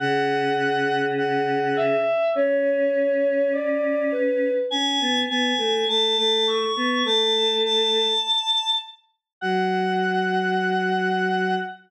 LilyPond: <<
  \new Staff \with { instrumentName = "Choir Aahs" } { \time 2/2 \key fis \minor \tempo 2 = 51 fis''2 fis''4 e''4 | cis''2 d''4 b'4 | gis''4 gis''4 a''8 a''8 cis'''4 | a''4 a''2 r4 |
fis''1 | }
  \new Staff \with { instrumentName = "Choir Aahs" } { \time 2/2 \key fis \minor cis1 | cis'1 | cis'8 b8 b8 a8 a8 a4 b8 | a2 r2 |
fis1 | }
>>